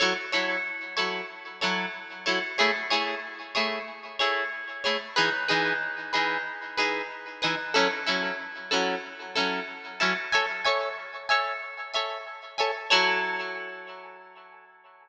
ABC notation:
X:1
M:4/4
L:1/8
Q:"Swing 16ths" 1/4=93
K:F#m
V:1 name="Acoustic Guitar (steel)"
[F,EAc] [F,EAc]2 [F,EAc]2 [F,EAc]2 [F,EAc] | [A,EGc] [A,EGc]2 [A,EGc]2 [A,EGc]2 [A,EGc] | [E,^DGB] [E,DGB]2 [E,DGB]2 [E,DGB]2 [E,DGB] | [F,CEA] [F,CEA]2 [F,CEA]2 [F,CEA]2 [F,CEA] |
[Aceg] [Aceg]2 [Aceg]2 [Aceg]2 [Aceg] | [F,EAc]8 |]